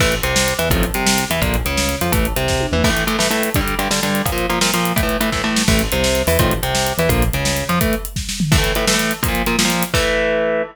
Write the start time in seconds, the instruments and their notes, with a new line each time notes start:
0.00 synth bass 1 A1, overdriven guitar E3 A3, kick, crash
0.12 closed hi-hat
0.23 synth bass 1 C2, overdriven guitar C3, closed hi-hat
0.36 snare
0.48 closed hi-hat
0.59 synth bass 1 E2, overdriven guitar E3, closed hi-hat
0.70 synth bass 1 A1, overdriven guitar D#3 F3 A3 C4, kick, closed hi-hat
0.83 closed hi-hat
0.94 synth bass 1 C2, overdriven guitar C3, closed hi-hat
1.06 snare
1.18 closed hi-hat
1.30 synth bass 1 E2, overdriven guitar E3, closed hi-hat
1.42 synth bass 1 A#1, overdriven guitar D3 F3 A#3, kick, closed hi-hat
1.54 closed hi-hat
1.65 synth bass 1 C#2, overdriven guitar C#3, closed hi-hat
1.77 snare
1.89 closed hi-hat
2.01 synth bass 1 F2, overdriven guitar F3, closed hi-hat
2.12 synth bass 1 A1, overdriven guitar E3 A3, kick, closed hi-hat
2.25 closed hi-hat
2.36 synth bass 1 C2, overdriven guitar C3, closed hi-hat
2.48 kick, snare
2.60 high tom
2.72 synth bass 1 E2, overdriven guitar E3, mid tom
2.84 overdriven guitar A2 E3 A3, kick, crash
2.90 overdriven guitar A2 E3 A3
2.97 closed hi-hat
3.07 overdriven guitar A2 E3 A3, closed hi-hat
3.19 overdriven guitar A2 E3 A3, snare
3.31 overdriven guitar A2 E3 A3, closed hi-hat
3.43 closed hi-hat
3.54 overdriven guitar G2 D3 G3, kick, closed hi-hat
3.61 overdriven guitar G2 D3 G3
3.68 closed hi-hat
3.79 overdriven guitar G2 D3 G3, closed hi-hat
3.91 overdriven guitar G2 D3 G3, snare
4.03 overdriven guitar G2 D3 G3, closed hi-hat
4.15 closed hi-hat
4.26 overdriven guitar A#2 F3 A#3, kick, closed hi-hat
4.32 overdriven guitar A#2 F3 A#3
4.38 closed hi-hat
4.50 overdriven guitar A#2 F3 A#3, closed hi-hat
4.61 overdriven guitar A#2 F3 A#3, snare
4.74 overdriven guitar A#2 F3 A#3, closed hi-hat
4.85 closed hi-hat
4.96 overdriven guitar A2 E3 A3, kick, closed hi-hat
5.03 overdriven guitar A2 E3 A3
5.09 closed hi-hat
5.21 overdriven guitar A2 E3 A3, closed hi-hat
5.32 overdriven guitar A2 E3 A3, kick, snare
5.44 overdriven guitar A2 E3 A3
5.56 snare
5.68 synth bass 1 A1, overdriven guitar E3 A3, kick, crash
5.79 closed hi-hat
5.92 synth bass 1 C2, overdriven guitar C3, closed hi-hat
6.04 snare
6.15 closed hi-hat
6.27 synth bass 1 E2, overdriven guitar E3, open hi-hat
6.39 synth bass 1 A1, overdriven guitar D#3 F3 A3 C4, kick, closed hi-hat
6.51 closed hi-hat
6.63 synth bass 1 C2, overdriven guitar C3, closed hi-hat
6.75 snare
6.87 closed hi-hat
6.98 synth bass 1 E2, overdriven guitar E3, closed hi-hat
7.09 synth bass 1 A#1, overdriven guitar D3 F3 A#3, kick, closed hi-hat
7.22 closed hi-hat
7.33 synth bass 1 C#2, overdriven guitar C#3, closed hi-hat
7.45 snare
7.57 closed hi-hat
7.69 synth bass 1 F2, overdriven guitar F3, closed hi-hat
7.81 overdriven guitar E3 A3, kick, closed hi-hat
7.93 closed hi-hat
8.05 closed hi-hat
8.16 kick, snare
8.29 snare
8.40 floor tom
8.52 overdriven guitar A2 E3 A3, kick, crash
8.58 overdriven guitar A2 E3 A3
8.64 closed hi-hat
8.75 overdriven guitar A2 E3 A3, closed hi-hat
8.87 overdriven guitar A2 E3 A3, snare
8.93 overdriven guitar A2 E3 A3
8.99 closed hi-hat
9.11 closed hi-hat
9.23 overdriven guitar A#2 F3 A#3, kick, closed hi-hat
9.28 overdriven guitar A#2 F3 A#3
9.35 closed hi-hat
9.46 overdriven guitar A#2 F3 A#3, closed hi-hat
9.59 overdriven guitar A#2 F3 A#3, snare
9.65 overdriven guitar A#2 F3 A#3
9.70 closed hi-hat
9.83 closed hi-hat
9.94 overdriven guitar E3 A3, kick, crash